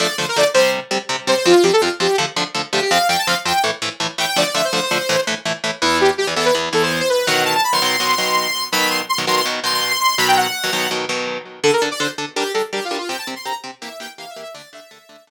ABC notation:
X:1
M:4/4
L:1/16
Q:1/4=165
K:Dm
V:1 name="Lead 2 (sawtooth)"
d2 c B d z c2 z6 c c | F2 G A F z G2 z6 G G | f2 g a f z g2 z6 g g | d d e c c c5 z6 |
[K:Em] E2 G z G z A B z2 A c2 c B2 | f2 a a b c' c'10 | b2 c' z c' z c' c' z2 c' c'2 c' c'2 | b g f6 z8 |
[K:Dm] A B z d c z3 G2 A z (3G2 F2 F2 | g a z c' b z3 e2 g z (3f2 e2 e2 | d2 e6 z8 |]
V:2 name="Overdriven Guitar"
[D,F,A,]2 [D,F,A,]2 [D,F,A,]2 [C,G,C]4 [C,G,C]2 [C,G,C]2 [C,G,C]2 | [F,,F,C]2 [F,,F,C]2 [F,,F,C]2 [F,,F,C]2 [D,F,A,]2 [D,F,A,]2 [D,F,A,]2 [D,F,A,]2 | [F,,F,C]2 [F,,F,C]2 [F,,F,C]2 [F,,F,C]2 [A,,E,A,]2 [A,,E,A,]2 [A,,E,A,]2 [A,,E,A,]2 | [D,F,A,]2 [D,F,A,]2 [D,F,A,]2 [D,F,A,]2 [A,,E,A,]2 [A,,E,A,]2 [A,,E,A,]2 [A,,E,A,]2 |
[K:Em] [E,,E,B,]5 [E,,E,B,] [E,,E,B,]2 [E,,E,B,]2 [E,,E,B,]6 | [B,,^D,F,]5 [B,,D,F,] [B,,D,F,]2 [B,,D,F,]2 [B,,D,F,]6 | [B,,^D,F,]5 [B,,D,F,] [B,,D,F,]2 [B,,D,F,]2 [B,,D,F,]6 | [B,,^D,F,]5 [B,,D,F,] [B,,D,F,]2 [B,,D,F,]2 [B,,D,F,]6 |
[K:Dm] [D,DA]2 [D,DA]2 [D,DA]2 [D,DA]2 [G,DB]2 [G,DB]2 [G,DB]2 [G,DB]2 | [C,CG]2 [C,CG]2 [C,CG]2 [C,CG]2 [E,B,G]2 [E,B,G]2 [E,B,G]2 [E,B,G]2 | [D,A,D]2 [D,A,D]2 [D,A,D]2 [D,A,D]2 [D,A,D]2 z6 |]